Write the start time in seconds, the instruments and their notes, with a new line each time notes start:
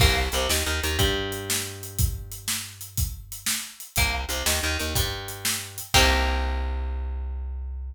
0.00 electric bass (finger) C2, acoustic guitar (steel) A#3, kick, crash
0.32 electric bass (finger) C2, acoustic guitar (steel) C3, closed hi-hat
0.49 electric bass (finger) D#2, acoustic guitar (steel) D#3, snare
0.66 electric bass (finger) D#2, acoustic guitar (steel) D#3
0.83 electric bass (finger) D#2, acoustic guitar (steel) D#3, closed hi-hat
0.99 electric bass (finger) G2, acoustic guitar (steel) G3, kick, closed hi-hat
1.32 closed hi-hat
1.50 snare
1.83 closed hi-hat
1.99 kick, closed hi-hat
2.32 closed hi-hat
2.48 snare
2.81 closed hi-hat
2.97 kick, closed hi-hat
3.32 closed hi-hat
3.46 snare
3.80 closed hi-hat
3.96 electric bass (finger) C2, acoustic guitar (steel) A#3, kick, closed hi-hat
4.29 electric bass (finger) C2, acoustic guitar (steel) C3, closed hi-hat
4.46 electric bass (finger) D#2, acoustic guitar (steel) D#3, snare
4.63 electric bass (finger) D#2, acoustic guitar (steel) D#3
4.79 electric bass (finger) D#2, acoustic guitar (steel) D#3, closed hi-hat
4.95 electric bass (finger) G2, acoustic guitar (steel) G3, kick, closed hi-hat
5.28 closed hi-hat
5.45 snare
5.78 closed hi-hat
5.94 electric bass (finger) C2, acoustic guitar (steel) A#3 C4 D#4 G4, kick, crash